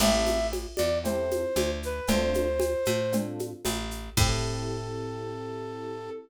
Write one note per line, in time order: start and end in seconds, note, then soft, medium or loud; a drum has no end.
0.00 0.67 A1 medium
0.00 0.37 C4 loud
0.00 0.37 E4 loud
0.00 0.37 G4 loud
0.00 0.37 A4 loud
0.00 0.47 E5 medium
0.00 crash loud
0.00 cowbell loud
0.00 low conga loud
0.00 shaker medium
0.27 high conga medium
0.27 shaker medium
0.52 cowbell medium
0.52 high conga medium
0.52 shaker medium
0.76 1.45 E2 medium
0.76 0.98 D5 medium
0.76 high conga medium
0.76 shaker medium
1.04 1.41 C4 medium
1.04 1.41 E4 loud
1.04 1.41 G4 medium
1.04 1.41 A4 medium
1.04 1.72 C5 medium
1.04 cowbell medium
1.04 low conga medium
1.04 shaker medium
1.31 high conga medium
1.31 shaker medium
1.56 2.00 D2 medium
1.56 cowbell medium
1.56 high conga medium
1.56 shaker medium
1.83 2.10 B4 medium
1.83 shaker medium
2.07 2.75 D2 medium
2.07 2.45 C4 loud
2.07 2.45 D4 loud
2.07 2.45 F4 loud
2.07 2.45 A4 loud
2.07 3.17 C5 medium
2.07 cowbell medium
2.07 low conga loud
2.07 shaker medium
2.34 high conga medium
2.34 shaker medium
2.60 cowbell medium
2.60 high conga medium
2.60 shaker medium
2.85 3.53 A2 medium
2.85 high conga medium
2.85 shaker medium
3.12 3.49 C4 medium
3.12 3.49 D4 medium
3.12 3.49 F4 loud
3.12 3.49 A4 medium
3.12 cowbell medium
3.12 low conga medium
3.12 shaker medium
3.39 high conga medium
3.39 shaker medium
3.65 4.10 A1 medium
3.65 cowbell medium
3.65 high conga medium
3.65 shaker medium
3.91 shaker medium
4.17 6.09 A2 loud
4.17 6.10 C4 loud
4.17 6.10 E4 loud
4.17 6.10 G4 loud
4.17 6.10 A4 loud
4.17 kick loud
4.17 crash loud